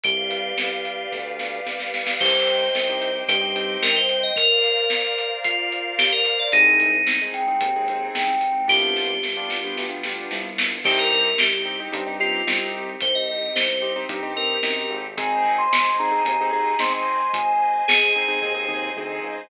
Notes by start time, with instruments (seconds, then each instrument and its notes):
0.03 synth bass 1 C2, electric piano 2 G4, pad 5 (bowed) G4 B4 D5 F5, kick, closed hi-hat
0.31 closed hi-hat
0.58 synth bass 1 C2, snare
0.85 closed hi-hat
1.12 synth bass 1 D2, kick, snare
1.39 snare
1.66 synth bass 1 C2, snare
1.80 snare
1.94 snare
2.07 snare
2.19 synth bass 1 C2, acoustic grand piano C4 D#4 G4, pad 5 (bowed) C5 D#5 G5, electric piano 2 C5, kick, crash
2.47 closed hi-hat
2.74 synth bass 1 C2, snare
2.89 acoustic grand piano C4 D#4 G4
3.02 closed hi-hat
3.15 acoustic grand piano C4 D#4 G4
3.28 synth bass 1 G2, electric piano 2 G4, kick, closed hi-hat
3.41 acoustic grand piano C4 D#4 G4
3.56 acoustic grand piano C4 D#4 G4, closed hi-hat
3.82 synth bass 1 C2, electric piano 2 A#4, snare
3.96 electric piano 2 C5
4.09 closed hi-hat
4.23 electric piano 2 D#5
4.35 pad 5 (bowed) A#4 C5 D5 F5, electric piano 2 A#4, kick, closed hi-hat
4.64 closed hi-hat
4.90 snare
5.18 closed hi-hat
5.44 electric piano 2 F4, kick, closed hi-hat
5.72 closed hi-hat
5.99 electric piano 2 G4, snare
6.12 electric piano 2 A#4
6.25 closed hi-hat
6.39 electric piano 2 D5
6.52 synth bass 1 C2, pad 5 (bowed) G#3 C4 D#4, acoustic grand piano C4 D#4 G#4, electric piano 2 D#4, kick, closed hi-hat
6.80 closed hi-hat
7.07 synth bass 1 C2, snare
7.21 acoustic grand piano C4 D#4 G#4
7.34 electric piano 2 G5, closed hi-hat
7.48 acoustic grand piano C4 D#4 G#4
7.61 synth bass 1 D#2, kick, closed hi-hat
7.76 acoustic grand piano C4 D#4 G#4
7.88 acoustic grand piano C4 D#4 G#4, closed hi-hat
8.15 synth bass 1 C2, electric piano 2 G5, snare
8.41 closed hi-hat
8.67 synth bass 1 C2, pad 5 (bowed) G3 B3 D4 F4, acoustic grand piano B3 D4 F4 G4, electric piano 2 G4, kick, snare
8.96 snare
9.23 synth bass 1 C2, snare
9.37 acoustic grand piano B3 D4 F4 G4
9.50 snare
9.64 acoustic grand piano B3 D4 F4 G4
9.77 synth bass 1 D2, snare
9.90 acoustic grand piano B3 D4 F4 G4
10.03 acoustic grand piano B3 D4 F4 G4, snare
10.31 synth bass 1 C2, snare
10.58 snare
10.83 synth bass 1 C2, pad 5 (bowed) C4 D#4 G4, acoustic grand piano C4 D#4 G4, electric piano 2 G4, kick, crash
10.99 electric piano 2 A#4
11.12 electric piano 2 A#4, kick
11.38 synth bass 1 C2, electric piano 2 G4, snare
11.65 acoustic grand piano C4 D#4 G4
11.80 acoustic grand piano C4 D#4 G4
11.92 synth bass 1 G2, acoustic grand piano C4 D#4 G4, kick, closed hi-hat
12.06 acoustic grand piano C4 D#4 G4
12.20 acoustic grand piano C4 D#4 G4, electric piano 2 F4
12.47 synth bass 1 C2, acoustic grand piano C4 D#4 G4, snare
13.00 synth bass 1 C2, electric piano 2 C5, kick, closed hi-hat
13.15 electric piano 2 D#5
13.29 electric piano 2 D#5
13.55 synth bass 1 C2, electric piano 2 C5, snare
13.82 acoustic grand piano C4 D#4 G4
13.96 acoustic grand piano C4 D#4 G4
14.09 synth bass 1 G2, acoustic grand piano C4 D#4 G4, kick, closed hi-hat
14.23 acoustic grand piano C4 D#4 G4
14.36 acoustic grand piano C4 D#4 G4, electric piano 2 A#4
14.63 synth bass 1 F#2, acoustic grand piano C4 D#4 G4, snare
14.90 synth bass 1 G#1
15.17 acoustic grand piano C4 D#4 G#4, pad 5 (bowed) C5 D#5 G#5, electric piano 2 G#5, kick, closed hi-hat
15.45 kick
15.58 electric piano 2 C6
15.72 synth bass 1 G#1, snare
15.99 acoustic grand piano C4 D#4 G#4, electric piano 2 A#5
16.12 acoustic grand piano C4 D#4 G#4
16.25 synth bass 1 D#2, acoustic grand piano C4 D#4 G#4, kick, closed hi-hat
16.41 acoustic grand piano C4 D#4 G#4
16.53 acoustic grand piano C4 D#4 G#4, electric piano 2 A#5
16.79 synth bass 1 G#1, acoustic grand piano C4 D#4 G#4, electric piano 2 C6, snare
16.93 electric piano 2 C6
17.33 synth bass 1 G#1, electric piano 2 G#5, kick, closed hi-hat
17.88 synth bass 1 G#1, electric piano 2 G#4, snare
18.15 acoustic grand piano C4 D#4 G#4
18.28 acoustic grand piano C4 D#4 G#4
18.42 synth bass 1 D#2, acoustic grand piano C4 D#4 G#4, kick, floor tom
18.54 acoustic grand piano C4 D#4 G#4
18.68 acoustic grand piano C4 D#4 G#4, mid tom
18.96 synth bass 1 D2, acoustic grand piano C4 D#4 G#4
19.23 synth bass 1 C#2